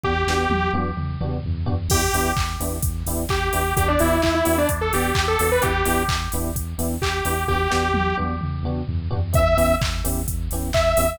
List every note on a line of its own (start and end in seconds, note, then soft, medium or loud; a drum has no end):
0.03 0.24 E2 loud
0.03 0.12 B3 loud
0.03 0.12 D4 medium
0.03 0.12 F#4 loud
0.03 0.12 G4 loud
0.03 0.72 G4 loud
0.03 kick medium
0.27 0.47 E2 medium
0.27 0.45 B3 medium
0.27 0.45 D4 medium
0.27 0.45 F#4 medium
0.27 0.45 G4 medium
0.27 snare medium
0.49 0.69 E2 loud
0.49 high tom medium
0.73 0.93 E2 medium
0.73 0.90 B3 medium
0.73 0.90 D4 medium
0.73 0.90 F#4 medium
0.73 0.90 G4 medium
0.73 high tom medium
0.97 1.17 E2 medium
0.97 mid tom medium
1.20 1.40 E2 medium
1.20 1.37 B3 medium
1.20 1.37 D4 medium
1.20 1.37 F#4 medium
1.20 1.37 G4 medium
1.20 mid tom medium
1.44 1.65 E2 loud
1.44 floor tom medium
1.66 1.88 E2 medium
1.66 1.74 B3 medium
1.66 1.74 D4 loud
1.66 1.74 F#4 medium
1.66 1.74 G4 medium
1.66 floor tom loud
1.88 2.08 E2 loud
1.88 2.00 B3 loud
1.88 2.00 D4 medium
1.88 2.00 E4 loud
1.88 2.31 G4 loud
1.88 2.00 G4 loud
1.88 kick medium
1.88 crash loud
2.13 2.33 E2 medium
2.13 2.30 B3 medium
2.13 2.30 D4 medium
2.13 2.30 E4 medium
2.13 2.30 G4 medium
2.13 open hi-hat medium
2.37 2.57 E2 medium
2.37 kick medium
2.37 clap medium
2.60 2.80 E2 medium
2.60 2.77 B3 medium
2.60 2.77 D4 medium
2.60 2.77 E4 medium
2.60 2.77 G4 medium
2.60 open hi-hat medium
2.82 3.03 E2 medium
2.82 kick medium
2.82 closed hi-hat loud
3.06 3.26 E2 medium
3.06 3.24 B3 medium
3.06 3.24 D4 medium
3.06 3.24 E4 loud
3.06 3.24 G4 loud
3.06 open hi-hat medium
3.29 3.49 E2 medium
3.29 3.74 G4 medium
3.29 kick medium
3.29 clap medium
3.53 3.73 E2 medium
3.53 3.61 B3 medium
3.53 3.61 D4 medium
3.53 3.61 E4 medium
3.53 3.61 G4 loud
3.53 open hi-hat medium
3.77 3.97 E2 loud
3.77 3.85 B3 loud
3.77 3.85 D4 loud
3.77 3.85 F#4 loud
3.77 3.85 G4 loud
3.77 3.88 G4 medium
3.77 kick medium
3.77 closed hi-hat loud
3.88 3.99 D4 medium
3.99 4.20 E2 loud
3.99 4.16 B3 medium
3.99 4.16 D4 loud
3.99 4.21 E4 medium
3.99 4.16 F#4 medium
3.99 4.16 G4 medium
3.99 open hi-hat medium
4.22 4.42 E2 medium
4.22 4.34 E4 medium
4.22 kick medium
4.22 clap medium
4.35 4.57 E4 medium
4.45 4.66 E2 medium
4.45 4.61 B3 medium
4.45 4.61 D4 medium
4.45 4.61 F#4 medium
4.45 4.61 G4 medium
4.45 open hi-hat medium
4.58 4.69 D4 medium
4.69 4.91 E2 medium
4.69 kick medium
4.69 closed hi-hat medium
4.81 4.92 A4 medium
4.93 5.12 E2 medium
4.93 5.11 B3 medium
4.93 5.11 D4 medium
4.93 5.11 F#4 medium
4.93 5.25 G4 medium
4.93 5.11 G4 medium
4.93 open hi-hat medium
5.15 5.36 E2 medium
5.15 kick medium
5.15 clap loud
5.28 5.50 A4 medium
5.39 5.59 E2 medium
5.39 5.48 B3 medium
5.39 5.48 D4 medium
5.39 5.48 F#4 medium
5.39 5.48 G4 medium
5.39 open hi-hat medium
5.52 5.63 B4 medium
5.61 5.83 E2 loud
5.61 5.70 B3 loud
5.61 5.70 D4 loud
5.61 5.70 E4 loud
5.61 5.70 G4 medium
5.61 6.03 G4 loud
5.61 kick medium
5.61 closed hi-hat medium
5.85 6.06 E2 medium
5.85 6.02 B3 medium
5.85 6.02 D4 medium
5.85 6.02 E4 medium
5.85 6.02 G4 medium
5.85 open hi-hat medium
6.08 6.28 E2 medium
6.08 kick medium
6.08 clap loud
6.32 6.53 E2 medium
6.32 6.50 B3 medium
6.32 6.50 D4 medium
6.32 6.50 E4 medium
6.32 6.50 G4 medium
6.32 open hi-hat medium
6.55 6.75 E2 medium
6.55 kick medium
6.55 closed hi-hat medium
6.78 6.98 E2 medium
6.78 6.95 B3 loud
6.78 6.95 D4 medium
6.78 6.95 E4 medium
6.78 6.95 G4 medium
6.78 open hi-hat medium
7.01 7.21 E2 medium
7.01 7.44 G4 medium
7.01 kick medium
7.01 clap loud
7.25 7.45 E2 medium
7.25 7.34 B3 medium
7.25 7.34 D4 loud
7.25 7.34 E4 medium
7.25 7.34 G4 medium
7.25 open hi-hat medium
7.48 7.67 E2 loud
7.48 7.57 B3 loud
7.48 7.57 D4 medium
7.48 7.57 F#4 loud
7.48 8.16 G4 loud
7.48 7.57 G4 loud
7.48 kick medium
7.70 7.93 E2 medium
7.70 7.87 B3 medium
7.70 7.87 D4 medium
7.70 7.87 F#4 medium
7.70 7.87 G4 medium
7.70 snare medium
7.93 8.13 E2 loud
7.93 high tom medium
8.17 8.39 E2 medium
8.17 8.34 B3 medium
8.17 8.34 D4 medium
8.17 8.34 F#4 medium
8.17 8.34 G4 medium
8.17 high tom medium
8.41 8.62 E2 medium
8.41 mid tom medium
8.63 8.83 E2 medium
8.63 8.81 B3 medium
8.63 8.81 D4 medium
8.63 8.81 F#4 medium
8.63 8.81 G4 medium
8.63 mid tom medium
8.88 9.08 E2 loud
8.88 floor tom medium
9.10 9.32 E2 medium
9.10 9.19 B3 medium
9.10 9.19 D4 loud
9.10 9.19 F#4 medium
9.10 9.19 G4 medium
9.10 floor tom loud
9.33 9.55 E2 loud
9.33 9.41 B3 loud
9.33 9.41 C#4 loud
9.33 9.41 E4 medium
9.33 9.41 G4 medium
9.33 9.75 E5 medium
9.33 kick loud
9.33 closed hi-hat medium
9.57 9.77 E2 loud
9.57 9.73 B3 medium
9.57 9.73 C#4 medium
9.57 9.73 E4 medium
9.57 9.73 G4 loud
9.57 open hi-hat medium
9.81 10.02 E2 medium
9.81 kick medium
9.81 clap loud
10.04 10.25 E2 medium
10.04 10.21 B3 medium
10.04 10.21 C#4 medium
10.04 10.21 E4 medium
10.04 10.21 G4 loud
10.04 open hi-hat medium
10.28 10.48 E2 medium
10.28 kick medium
10.28 closed hi-hat medium
10.51 10.71 E2 medium
10.51 10.69 B3 medium
10.51 10.69 C#4 medium
10.51 10.69 E4 medium
10.51 10.69 G4 medium
10.51 open hi-hat medium
10.73 10.94 E2 loud
10.73 11.18 E5 medium
10.73 kick medium
10.73 clap loud
10.97 11.16 E2 medium
10.97 11.05 B3 medium
10.97 11.05 C#4 medium
10.97 11.05 E4 medium
10.97 11.05 G4 medium
10.97 open hi-hat medium